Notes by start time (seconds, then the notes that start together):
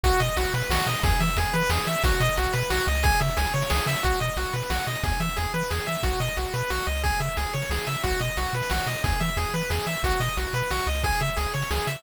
0.04 B1 F#4, kick, closed hi-hat
0.13 closed hi-hat
0.20 B2 D#5, closed hi-hat
0.29 closed hi-hat
0.37 B1 F#4, closed hi-hat
0.45 closed hi-hat
0.54 B2 B4, closed hi-hat
0.62 closed hi-hat
0.70 B1 F#4, snare
0.78 closed hi-hat
0.87 B2 D#5, closed hi-hat
0.95 closed hi-hat
1.03 E2 G#4, kick, closed hi-hat
1.11 closed hi-hat
1.20 E3 E5, closed hi-hat
1.29 closed hi-hat
1.37 E2 G#4, closed hi-hat
1.46 closed hi-hat
1.53 E3 B4, closed hi-hat
1.62 closed hi-hat
1.70 E2 G#4, snare
1.78 closed hi-hat
1.86 E3 E5, closed hi-hat
1.96 closed hi-hat
2.04 B1 F#4, kick, closed hi-hat
2.12 closed hi-hat
2.20 B2 D#5, closed hi-hat
2.29 closed hi-hat
2.37 B1 F#4, closed hi-hat
2.46 closed hi-hat
2.53 B2 B4, closed hi-hat
2.63 closed hi-hat
2.70 B1 F#4, snare
2.78 closed hi-hat
2.87 C#2 D#5, closed hi-hat
2.95 closed hi-hat
3.03 G#4, kick, closed hi-hat
3.12 closed hi-hat
3.21 C#3 E5, closed hi-hat
3.29 closed hi-hat
3.37 C#2 G#4, closed hi-hat
3.45 closed hi-hat
3.54 C#3 C#5, closed hi-hat
3.62 closed hi-hat
3.70 C#2 G#4, snare
3.78 closed hi-hat
3.86 C#3 E5, closed hi-hat
3.96 closed hi-hat
4.03 B1 F#4, kick, closed hi-hat
4.12 closed hi-hat
4.20 B2 D#5, closed hi-hat
4.29 closed hi-hat
4.37 B1 F#4, closed hi-hat
4.46 closed hi-hat
4.53 B2 B4, closed hi-hat
4.62 closed hi-hat
4.70 B1 F#4, snare
4.79 closed hi-hat
4.87 B2 D#5, closed hi-hat
4.95 closed hi-hat
5.03 E2 G#4, kick, closed hi-hat
5.12 closed hi-hat
5.20 E3 E5, closed hi-hat
5.29 closed hi-hat
5.36 E2 G#4, closed hi-hat
5.45 closed hi-hat
5.54 E3 B4, closed hi-hat
5.63 closed hi-hat
5.70 E2 G#4, snare
5.79 closed hi-hat
5.87 E3 E5, closed hi-hat
5.95 closed hi-hat
6.03 B1 F#4, kick, closed hi-hat
6.13 closed hi-hat
6.20 B2 D#5, closed hi-hat
6.28 closed hi-hat
6.37 B1 F#4, closed hi-hat
6.46 closed hi-hat
6.54 B2 B4, closed hi-hat
6.62 closed hi-hat
6.70 B1 F#4, snare
6.79 closed hi-hat
6.87 C#2 D#5, closed hi-hat
6.95 closed hi-hat
7.03 G#4, kick, closed hi-hat
7.12 closed hi-hat
7.20 C#3 E5, closed hi-hat
7.28 closed hi-hat
7.37 C#2 G#4, closed hi-hat
7.46 closed hi-hat
7.53 C#3 C#5, closed hi-hat
7.62 closed hi-hat
7.70 C#2 G#4, snare
7.79 closed hi-hat
7.87 C#3 E5, closed hi-hat
7.95 closed hi-hat
8.03 B1 F#4, kick, closed hi-hat
8.12 closed hi-hat
8.20 B2 D#5, closed hi-hat
8.28 closed hi-hat
8.37 B1 F#4, closed hi-hat
8.46 closed hi-hat
8.53 B2 B4, closed hi-hat
8.62 closed hi-hat
8.70 B1 F#4, snare
8.80 closed hi-hat
8.86 B2 D#5, closed hi-hat
8.96 closed hi-hat
9.04 E2 G#4, kick, closed hi-hat
9.12 closed hi-hat
9.20 E3 E5, closed hi-hat
9.29 closed hi-hat
9.37 E2 G#4, closed hi-hat
9.46 closed hi-hat
9.54 E3 B4, closed hi-hat
9.62 closed hi-hat
9.70 E2 G#4, snare
9.79 closed hi-hat
9.86 E3 E5, closed hi-hat
9.95 closed hi-hat
10.03 B1 F#4, kick, closed hi-hat
10.12 closed hi-hat
10.20 B2 D#5, closed hi-hat
10.28 closed hi-hat
10.37 B1 F#4, closed hi-hat
10.46 closed hi-hat
10.53 B2 B4, closed hi-hat
10.63 closed hi-hat
10.71 B1 F#4, snare
10.79 closed hi-hat
10.86 C#2 D#5, closed hi-hat
10.95 closed hi-hat
11.03 G#4, kick, closed hi-hat
11.12 closed hi-hat
11.20 C#3 E5, closed hi-hat
11.28 closed hi-hat
11.37 C#2 G#4, closed hi-hat
11.46 closed hi-hat
11.54 C#3 C#5, closed hi-hat
11.62 closed hi-hat
11.71 C#2 G#4, snare
11.78 closed hi-hat
11.87 C#3 E5, closed hi-hat
11.95 closed hi-hat